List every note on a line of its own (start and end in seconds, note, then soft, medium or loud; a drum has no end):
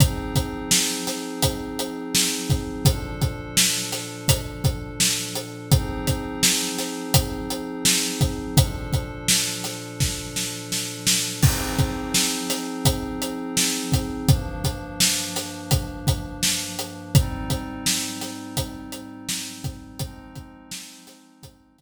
0.00 2.82 F3 medium
0.00 2.82 C4 medium
0.00 2.82 D#4 medium
0.00 2.82 G#4 medium
0.00 kick loud
0.00 closed hi-hat loud
0.35 kick medium
0.35 closed hi-hat medium
0.71 snare loud
1.07 snare medium
1.07 closed hi-hat medium
1.42 kick medium
1.42 closed hi-hat loud
1.79 closed hi-hat medium
2.15 snare loud
2.50 kick loud
2.50 closed hi-hat medium
2.85 5.68 A#2 medium
2.85 5.68 F3 medium
2.85 5.68 D4 medium
2.85 5.68 A4 medium
2.85 kick loud
2.85 closed hi-hat loud
3.21 kick medium
3.21 closed hi-hat medium
3.57 snare loud
3.92 snare medium
3.92 closed hi-hat medium
4.28 kick loud
4.28 closed hi-hat loud
4.64 kick loud
4.64 closed hi-hat medium
5.00 snare loud
5.35 closed hi-hat medium
5.71 8.54 F3 medium
5.71 8.54 C4 medium
5.71 8.54 D#4 medium
5.71 8.54 G#4 medium
5.71 kick loud
5.71 closed hi-hat loud
6.07 kick medium
6.07 closed hi-hat medium
6.43 snare loud
6.78 snare medium
6.78 closed hi-hat medium
7.14 kick loud
7.14 closed hi-hat loud
7.50 closed hi-hat medium
7.85 snare loud
8.21 kick loud
8.21 closed hi-hat medium
8.56 11.39 A#2 medium
8.56 11.39 F3 medium
8.56 11.39 D4 medium
8.56 11.39 A4 medium
8.56 kick loud
8.56 closed hi-hat loud
8.93 kick medium
8.93 closed hi-hat medium
9.28 snare loud
9.64 snare medium
9.64 closed hi-hat medium
10.00 kick medium
10.00 snare medium
10.36 snare medium
10.72 snare medium
11.07 snare loud
11.43 14.26 F3 medium
11.43 14.26 C4 medium
11.43 14.26 D#4 medium
11.43 14.26 G#4 medium
11.43 kick loud
11.43 crash loud
11.79 kick loud
11.79 closed hi-hat medium
12.14 snare loud
12.50 snare medium
12.50 closed hi-hat medium
12.85 kick loud
12.85 closed hi-hat loud
13.22 closed hi-hat medium
13.57 snare loud
13.92 kick medium
13.92 closed hi-hat medium
14.28 17.11 G2 medium
14.28 17.11 F3 medium
14.28 17.11 A#3 medium
14.28 17.11 D4 medium
14.28 kick loud
14.28 closed hi-hat loud
14.64 kick medium
14.64 closed hi-hat medium
15.00 snare loud
15.36 snare medium
15.36 closed hi-hat medium
15.71 kick loud
15.71 closed hi-hat loud
16.07 kick loud
16.07 closed hi-hat medium
16.43 snare loud
16.79 closed hi-hat medium
17.15 19.98 G#2 medium
17.15 19.98 G3 medium
17.15 19.98 C4 medium
17.15 19.98 D#4 medium
17.15 kick loud
17.15 closed hi-hat loud
17.50 kick medium
17.50 closed hi-hat medium
17.86 snare loud
18.21 snare medium
18.21 closed hi-hat medium
18.57 kick medium
18.57 closed hi-hat loud
18.92 closed hi-hat medium
19.29 snare loud
19.64 kick loud
19.64 closed hi-hat medium
19.99 21.81 F3 medium
19.99 21.81 G#3 medium
19.99 21.81 C4 medium
19.99 21.81 D#4 medium
19.99 kick loud
19.99 closed hi-hat loud
20.35 kick medium
20.35 closed hi-hat medium
20.71 snare loud
21.07 snare medium
21.07 closed hi-hat medium
21.43 kick loud
21.43 closed hi-hat loud
21.78 kick medium
21.78 closed hi-hat medium